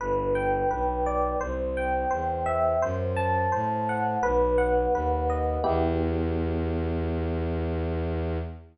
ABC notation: X:1
M:4/4
L:1/8
Q:1/4=85
K:Em
V:1 name="Electric Piano 1"
B g B d c g c e | c a c f B f B ^d | [B,EG]8 |]
V:2 name="Violin" clef=bass
G,,,2 B,,,2 C,,2 E,,2 | F,,2 A,,2 B,,,2 ^D,,2 | E,,8 |]